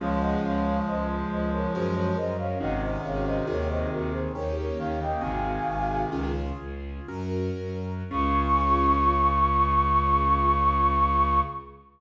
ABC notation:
X:1
M:3/4
L:1/16
Q:1/4=69
K:Db
V:1 name="Flute"
[df] [eg] [df]2 [ce] z [ce] [Bd] [Ac] [Bd] [ce] [df] | [eg] [ce] [df] [ce] [Bd] [ce] [GB] [Ac] [Bd] [Bd] [df] [e=g] | "^rit." [fa]4 z8 | d'12 |]
V:2 name="Clarinet" clef=bass
[F,A,]12 | [C,E,]8 z2 E, D, | "^rit." [C,E,]6 z6 | D,12 |]
V:3 name="Acoustic Grand Piano"
[DFA]8 [DGB]4 | [DEGA]4 [CEGA]4 [B,DE=G]4 | "^rit." [CEGA]4 [DFA]4 [DGB]4 | [DFA]12 |]
V:4 name="Violin" clef=bass
D,,2 D,,2 D,,2 D,,2 G,,2 G,,2 | A,,,2 A,,,2 E,,2 E,,2 E,,2 E,,2 | "^rit." A,,,2 A,,,2 D,,2 D,,2 G,,2 G,,2 | D,,12 |]